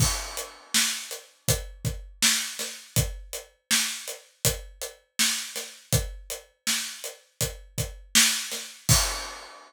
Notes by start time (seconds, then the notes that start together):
0.00 kick, crash
0.37 closed hi-hat
0.74 snare
1.11 closed hi-hat
1.48 kick, closed hi-hat
1.85 kick, closed hi-hat
2.22 snare
2.59 snare, closed hi-hat
2.96 kick, closed hi-hat
3.33 closed hi-hat
3.71 snare
4.08 closed hi-hat
4.45 kick, closed hi-hat
4.81 closed hi-hat
5.19 snare
5.56 snare, closed hi-hat
5.93 kick, closed hi-hat
6.30 closed hi-hat
6.67 snare
7.04 closed hi-hat
7.41 kick, closed hi-hat
7.78 kick, closed hi-hat
8.15 snare
8.52 snare, closed hi-hat
8.89 kick, crash